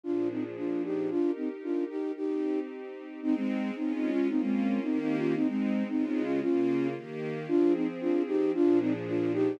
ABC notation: X:1
M:2/4
L:1/16
Q:1/4=113
K:Eb
V:1 name="Flute"
[DF]2 [CE] z [DF]2 [EG]2 | [DF]2 [CE] z [DF]2 [EG]2 | [EG]4 z4 | [K:Ab] [CE] [A,C]3 (3[CE]2 [CE]2 [DF]2 |
[CE] [A,C]3 (3[CE]2 [CE]2 [DF]2 | [CE] [A,C]3 (3[CE]2 [CE]2 [DF]2 | [DF]4 z4 | [K:Eb] [DF]2 [CE] z [DF]2 [EG]2 |
[DF]2 [CE] z [DF]2 [EG]2 |]
V:2 name="String Ensemble 1"
[B,,F,DA]8 | [EGB]8 | [CEG]8 | [K:Ab] [A,CE]4 [A,DF]4 |
[B,DF]4 [E,B,G]4 | [A,CE]4 [D,A,F]4 | [D,B,F]4 [E,B,G]4 | [K:Eb] [F,CA]8 |
[B,,F,DA]8 |]